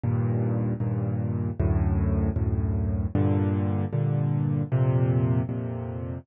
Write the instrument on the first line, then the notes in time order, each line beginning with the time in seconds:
acoustic grand piano
0.04 D#2 G2 A#2
0.80 D#2 G2 A#2
1.60 D2 F#2 A2
2.36 D2 F#2 A2
3.15 G2 A#2 D3
3.93 G2 A#2 D3
4.72 F2 A#2 C3
5.49 F2 A#2 C3